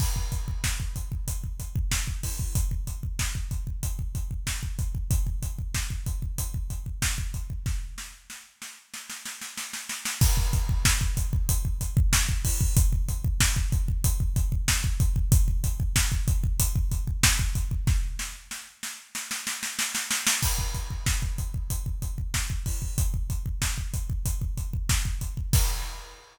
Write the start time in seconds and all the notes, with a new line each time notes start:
0.00 kick, crash
0.16 kick
0.32 kick, closed hi-hat
0.48 kick
0.64 kick, snare
0.80 kick
0.96 kick, closed hi-hat
1.12 kick
1.28 kick, closed hi-hat
1.44 kick
1.60 kick, closed hi-hat
1.76 kick
1.91 kick, snare
2.07 kick
2.23 kick, open hi-hat
2.39 kick
2.55 kick, closed hi-hat
2.71 kick
2.87 kick, closed hi-hat
3.03 kick
3.19 kick, snare
3.35 kick
3.51 kick, closed hi-hat
3.67 kick
3.83 kick, closed hi-hat
3.99 kick
4.15 kick, closed hi-hat
4.31 kick
4.47 kick, snare
4.63 kick
4.79 kick, closed hi-hat
4.95 kick
5.11 kick, closed hi-hat
5.27 kick
5.43 kick, closed hi-hat
5.59 kick
5.74 kick, snare
5.90 kick
6.06 kick, closed hi-hat
6.22 kick
6.38 kick, closed hi-hat
6.54 kick
6.70 kick, closed hi-hat
6.86 kick
7.02 kick, snare
7.18 kick
7.34 kick, closed hi-hat
7.50 kick
7.66 kick, snare
7.98 snare
8.30 snare
8.62 snare
8.94 snare
9.10 snare
9.26 snare
9.41 snare
9.57 snare
9.73 snare
9.89 snare
10.05 snare
10.21 kick, crash
10.37 kick
10.53 kick, closed hi-hat
10.69 kick
10.85 kick, snare
11.01 kick
11.17 kick, closed hi-hat
11.33 kick
11.49 kick, closed hi-hat
11.65 kick
11.81 kick, closed hi-hat
11.97 kick
12.13 kick, snare
12.29 kick
12.45 kick, open hi-hat
12.61 kick
12.77 kick, closed hi-hat
12.93 kick
13.09 kick, closed hi-hat
13.24 kick
13.40 kick, snare
13.56 kick
13.72 kick, closed hi-hat
13.88 kick
14.04 kick, closed hi-hat
14.20 kick
14.36 kick, closed hi-hat
14.52 kick
14.68 kick, snare
14.84 kick
15.00 kick, closed hi-hat
15.16 kick
15.32 kick, closed hi-hat
15.48 kick
15.64 kick, closed hi-hat
15.80 kick
15.96 kick, snare
16.12 kick
16.28 kick, closed hi-hat
16.44 kick
16.60 kick, closed hi-hat
16.76 kick
16.91 kick, closed hi-hat
17.07 kick
17.23 kick, snare
17.39 kick
17.55 kick, closed hi-hat
17.71 kick
17.87 kick, snare
18.19 snare
18.51 snare
18.83 snare
19.15 snare
19.31 snare
19.47 snare
19.63 snare
19.79 snare
19.95 snare
20.11 snare
20.27 snare
20.43 kick, crash
20.59 kick
20.74 kick, closed hi-hat
20.90 kick
21.06 kick, snare
21.22 kick
21.38 kick, closed hi-hat
21.54 kick
21.70 kick, closed hi-hat
21.86 kick
22.02 kick, closed hi-hat
22.18 kick
22.34 kick, snare
22.50 kick
22.66 kick, open hi-hat
22.82 kick
22.98 kick, closed hi-hat
23.14 kick
23.30 kick, closed hi-hat
23.46 kick
23.62 kick, snare
23.78 kick
23.94 kick, closed hi-hat
24.10 kick
24.26 kick, closed hi-hat
24.41 kick
24.57 kick, closed hi-hat
24.73 kick
24.89 kick, snare
25.05 kick
25.21 kick, closed hi-hat
25.37 kick
25.53 kick, crash